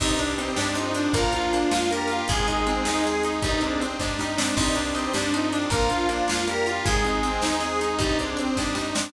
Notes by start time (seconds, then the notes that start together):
0.00 C2 G2 G3 C4 D4 D#4 G4, kick, crash
0.18 D4, closed hi-hat
0.38 C4 D#4, closed hi-hat
0.56 G2 D4 G4, snare
0.75 F2 F3 C4 D#4, closed hi-hat
0.94 D4, closed hi-hat
1.13 A#1 F3 A#3 D4 F4 A#4, kick, closed hi-hat
1.33 D4 F4, closed hi-hat
1.53 A#3 D4 F4, closed hi-hat
1.71 F2 A#3 D4 F4, snare
1.91 G3 A#3 D4 G4 A#4, closed hi-hat
2.08 F4, closed hi-hat
2.28 G#1 G#3 C4 D#4 G#4, kick, closed hi-hat
2.47 C4 D#4, closed hi-hat
2.67 G#3 C4 D#4, closed hi-hat
2.85 D#2 G#3 C4 D#4, snare
3.04 G#3 C4 G#4, closed hi-hat
3.23 D#4, closed hi-hat
3.42 C2 G2 G3 C4 D4 D#4, kick, closed hi-hat
3.61 G#2 G#3 C4 D4, closed hi-hat
3.80 C4 D4, closed hi-hat
3.99 G2 D4 D#4, kick, snare
4.18 G3 D#4, snare
4.37 C4 D4, snare
4.57 C2 G2 G3 C4 D4 D#4 G4, kick, crash
4.75 D4, closed hi-hat
4.95 C4 D#4, closed hi-hat
5.13 G2 D4 G4, snare
5.33 F2 F3 C4 D#4, closed hi-hat
5.52 D4, closed hi-hat
5.70 A#1 F3 A#3 D4 F4 A#4, kick, closed hi-hat
5.89 D4 F4, closed hi-hat
6.09 A#3 D4 F4, closed hi-hat
6.28 F2 A#3 D4 F4, snare
6.47 G3 A#3 D4 G4 A#4, closed hi-hat
6.66 F4, closed hi-hat
6.85 G#1 G#3 C4 D#4 G#4, kick, closed hi-hat
7.04 C4 D#4, closed hi-hat
7.23 G#3 C4 D#4, closed hi-hat
7.41 D#2 G#3 C4 D#4, snare
7.60 G#3 C4 G#4, closed hi-hat
7.81 D#4, closed hi-hat
7.99 C2 G2 G3 C4 D4 D#4, kick, closed hi-hat
8.19 G#2 G#3 C4 D4, closed hi-hat
8.37 C4 D4, closed hi-hat
8.57 G2 D4 D#4, kick, snare
8.75 G3 D#4, snare
8.95 C4 D4, snare